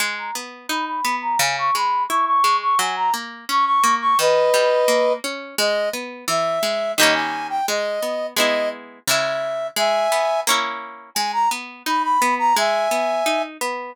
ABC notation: X:1
M:2/4
L:1/16
Q:1/4=86
K:G#m
V:1 name="Clarinet"
g a z2 b b2 a | g c' b2 c' c'2 c' | g a z2 c' c'2 c' | [Bd]6 z2 |
d2 z2 e4 | d g2 =g d4 | d2 z2 e4 | [eg]4 z4 |
g a z2 b b2 a | [eg]6 z2 |]
V:2 name="Acoustic Guitar (steel)"
G,2 B,2 D2 B,2 | C,2 G,2 E2 G,2 | F,2 A,2 C2 A,2 | D,2 =G,2 A,2 C2 |
G,2 B,2 E,2 G,2 | [D,=G,A,C]4 ^G,2 B,2 | [G,B,E]4 [C,G,E]4 | G,2 B,2 [A,CE]4 |
G,2 B,2 D2 B,2 | G,2 B,2 D2 B,2 |]